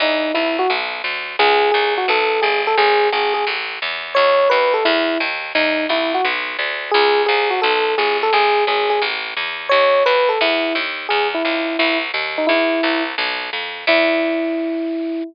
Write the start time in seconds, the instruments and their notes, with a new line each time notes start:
0.00 electric bass (finger) E2, electric piano 1 D#4
0.34 electric bass (finger) C2, electric piano 1 E4
0.59 electric piano 1 F#4
0.70 electric bass (finger) B1
1.04 electric bass (finger) D2
1.39 electric bass (finger) C#2, electric piano 1 G#4
1.71 electric bass (finger) C2, electric piano 1 G#4
1.98 electric piano 1 F#4
2.08 electric bass (finger) B1, electric piano 1 A4
2.42 electric bass (finger) G1, electric piano 1 G#4
2.67 electric piano 1 A4
2.77 electric bass (finger) G#1, electric piano 1 G#4
3.12 electric bass (finger) G#1, electric piano 1 G#4
3.34 electric piano 1 G#4
3.47 electric bass (finger) A1
3.82 electric bass (finger) E2
4.15 electric bass (finger) D#2, electric piano 1 C#5
4.50 electric bass (finger) D#2, electric piano 1 B4
4.74 electric piano 1 A4
4.85 electric bass (finger) E2, electric piano 1 E4
5.20 electric bass (finger) D#2
5.55 electric bass (finger) E2, electric piano 1 D#4
5.89 electric bass (finger) C2, electric piano 1 E4
6.14 electric piano 1 F#4
6.25 electric bass (finger) B1
6.59 electric bass (finger) D2
6.91 electric bass (finger) C#2, electric piano 1 G#4
7.26 electric bass (finger) C2, electric piano 1 G#4
7.50 electric piano 1 F#4
7.62 electric bass (finger) B1, electric piano 1 A4
7.98 electric bass (finger) G1, electric piano 1 G#4
8.23 electric piano 1 A4
8.33 electric bass (finger) G#1, electric piano 1 G#4
8.67 electric bass (finger) G#1, electric piano 1 G#4
8.90 electric piano 1 G#4
9.02 electric bass (finger) A1
9.37 electric bass (finger) E2
9.69 electric bass (finger) D#2, electric piano 1 C#5
10.06 electric bass (finger) D#2, electric piano 1 B4
10.29 electric piano 1 A4
10.41 electric bass (finger) E2, electric piano 1 E4
10.75 electric bass (finger) D#2
11.09 electric bass (finger) E2, electric piano 1 G#4
11.34 electric piano 1 E4
11.45 electric bass (finger) C#2
11.79 electric bass (finger) C2, electric piano 1 E4
12.14 electric bass (finger) D#2
12.38 electric piano 1 D#4
12.47 electric bass (finger) E2, electric piano 1 E4
12.83 electric bass (finger) C2
13.18 electric bass (finger) B1
13.53 electric bass (finger) F2
13.87 electric bass (finger) E2, electric piano 1 E4